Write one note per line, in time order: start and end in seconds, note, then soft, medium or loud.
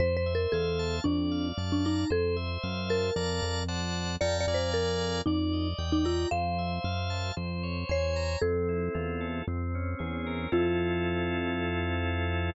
0.00 0.47 F2 loud
0.00 0.16 C5 loud
0.00 1.00 C5 medium
0.17 0.33 C5 medium
0.26 1.01 E5 medium
0.35 0.52 A#4 medium
0.52 1.00 E2 medium
0.52 0.96 A4 medium
0.52 1.04 F5 medium
0.79 1.04 A5 medium
1.04 1.52 F2 loud
1.04 1.48 D4 medium
1.04 2.05 D5 medium
1.31 2.06 F5 medium
1.58 2.05 F#2 medium
1.58 2.08 A5 medium
1.72 1.85 D4 medium
1.85 2.10 D#4 medium
1.85 2.10 A#5 medium
2.10 2.58 F2 medium
2.10 2.36 A4 loud
2.10 3.10 C5 loud
2.36 3.11 E5 medium
2.63 3.11 F#2 medium
2.63 3.13 F5 medium
2.89 3.65 A#4 medium
2.89 3.14 A5 medium
3.16 3.41 F2 medium
3.16 3.63 D5 medium
3.16 3.63 F5 medium
3.16 3.63 A5 medium
3.16 3.63 A#5 loud
3.42 4.17 F2 medium
3.68 4.16 C5 medium
3.68 4.16 D5 medium
3.68 4.16 F#5 medium
3.68 4.16 A5 loud
4.21 4.46 F2 medium
4.21 4.37 D5 medium
4.21 4.46 F5 medium
4.21 4.46 G5 loud
4.21 4.46 A5 loud
4.21 4.46 A#5 loud
4.41 4.57 D5 medium
4.47 5.22 F2 medium
4.47 5.21 D5 loud
4.47 5.21 F5 loud
4.47 5.21 G#5 medium
4.47 5.21 A#5 medium
4.54 4.71 C5 medium
4.74 5.21 A#4 medium
5.26 5.74 F2 medium
5.26 5.68 D#4 medium
5.26 6.27 D5 loud
5.53 6.28 D#5 medium
5.78 6.26 E2 medium
5.78 6.28 G5 medium
5.92 6.05 D#4 medium
6.05 6.29 F4 medium
6.05 6.30 A#5 medium
6.31 6.79 F2 medium
6.31 7.32 C5 loud
6.31 7.65 F5 loud
6.58 7.33 E5 medium
6.84 7.32 F#2 medium
6.84 7.34 F5 medium
7.10 7.35 A5 medium
7.37 7.84 F2 medium
7.37 8.37 C5 medium
7.63 8.38 C#5 medium
7.89 8.37 E2 medium
7.89 8.38 C#5 medium
7.89 8.39 G#5 medium
8.16 8.41 A#5 medium
8.42 8.89 F2 medium
8.42 9.42 C4 loud
8.42 9.27 A4 medium
8.69 9.44 E4 medium
8.94 9.42 E2 medium
8.94 9.44 F4 medium
9.21 9.46 A4 medium
9.48 9.95 F2 medium
9.48 10.48 C4 medium
9.75 10.50 C#4 medium
9.99 10.47 E2 medium
9.99 10.49 G#4 medium
10.26 10.51 A#4 medium
10.52 12.51 F2 loud
10.52 12.50 C4 medium
10.52 12.50 E4 loud
10.52 12.50 F4 loud
10.52 12.52 F4 loud
10.52 12.50 A4 loud